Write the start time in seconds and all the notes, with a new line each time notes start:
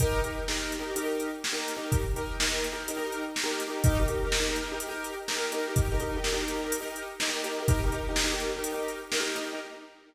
0.00 D#4 G4 A#4, kick, closed hi-hat
0.24 D#4 G4 A#4, closed hi-hat
0.48 D#4 G4 A#4, snare
0.72 closed hi-hat
0.79 D#4 G4 A#4
0.96 D#4 G4 A#4, closed hi-hat
1.03 D#4 G4 A#4
1.20 closed hi-hat
1.44 snare
1.52 D#4 G4 A#4
1.68 closed hi-hat
1.76 D#4 G4 A#4
1.92 kick, closed hi-hat
2.16 D#4 G4 A#4, closed hi-hat
2.40 D#4 G4 A#4, snare
2.64 closed hi-hat
2.72 D#4 G4 A#4
2.88 D#4 G4 A#4, closed hi-hat
2.97 D#4 G4 A#4
3.12 closed hi-hat
3.36 snare
3.43 D#4 G4 A#4
3.60 closed hi-hat
3.68 D#4 G4 A#4
3.84 D#4 G4 A#4, kick, closed hi-hat
3.99 D#4 G4 A#4
4.08 D#4 G4 A#4, closed hi-hat
4.24 D#4 G4 A#4
4.32 snare
4.39 D#4 G4 A#4
4.48 D#4 G4 A#4
4.56 closed hi-hat
4.71 D#4 G4 A#4
4.80 closed hi-hat
4.88 D#4 G4 A#4
5.04 closed hi-hat
5.28 D#4 G4 A#4, snare
5.36 D#4 G4 A#4
5.52 D#4 G4 A#4, closed hi-hat
5.67 D#4 G4 A#4
5.76 kick, closed hi-hat
5.92 D#4 G4 A#4
6.00 D#4 G4 A#4, closed hi-hat
6.16 D#4 G4 A#4
6.24 snare
6.32 D#4 G4 A#4
6.40 D#4 G4 A#4
6.48 closed hi-hat
6.64 D#4 G4 A#4
6.72 closed hi-hat
6.80 D#4 G4 A#4
6.96 closed hi-hat
7.20 D#4 G4 A#4, snare
7.28 D#4 G4 A#4
7.44 D#4 G4 A#4, closed hi-hat
7.60 D#4 G4 A#4
7.68 D#4 G4 A#4, kick, closed hi-hat
7.84 D#4 G4 A#4
7.92 D#4 G4 A#4, closed hi-hat
8.08 D#4 G4 A#4
8.16 snare
8.24 D#4 G4 A#4
8.32 D#4 G4 A#4
8.40 closed hi-hat
8.56 D#4 G4 A#4
8.64 closed hi-hat
8.72 D#4 G4 A#4
8.88 closed hi-hat
9.12 D#4 G4 A#4, snare
9.20 D#4 G4 A#4
9.35 D#4 G4 A#4, closed hi-hat
9.52 D#4 G4 A#4